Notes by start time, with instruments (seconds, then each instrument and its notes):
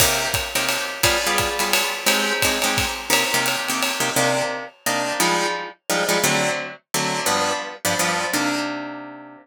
0.00 acoustic guitar (steel) C3 A#3 D#4 G4, kick, crash, ride
0.34 kick, hi-hat pedal, ride
0.55 acoustic guitar (steel) C3 A#3 D#4 G4, ride
0.69 ride
1.03 acoustic guitar (steel) G3 B3 F4 G#4, kick, ride
1.26 acoustic guitar (steel) G3 B3 F4 G#4
1.38 kick, hi-hat pedal, ride
1.59 acoustic guitar (steel) G3 B3 F4 G#4, ride
1.73 ride
2.06 acoustic guitar (steel) G#3 C4 D#4 G4, ride
2.42 acoustic guitar (steel) G#3 C4 D#4 G4, kick, hi-hat pedal, ride
2.62 acoustic guitar (steel) G#3 C4 D#4 G4, ride
2.78 kick, ride
3.10 acoustic guitar (steel) C3 A#3 D#4 G4, ride
3.34 acoustic guitar (steel) C3 A#3 D#4 G4
3.46 hi-hat pedal, ride
3.68 acoustic guitar (steel) C3 A#3 D#4 G4, ride
3.83 ride
4.00 acoustic guitar (steel) C3 A#3 D#4 G4
4.16 acoustic guitar (steel) C3 A#3 D4 D#4
4.86 acoustic guitar (steel) C3 A#3 D4 D#4
5.20 acoustic guitar (steel) F3 G3 G#3 D#4
5.90 acoustic guitar (steel) F3 G3 G#3 D#4
6.09 acoustic guitar (steel) F3 G3 G#3 D#4
6.24 acoustic guitar (steel) D3 F#3 A3 C4
6.94 acoustic guitar (steel) D3 F#3 A3 C4
7.26 acoustic guitar (steel) G2 F3 B3 D4
7.85 acoustic guitar (steel) G2 F3 B3 D4
7.99 acoustic guitar (steel) G2 F3 B3 D4
8.33 acoustic guitar (steel) C3 A#3 D4 D#4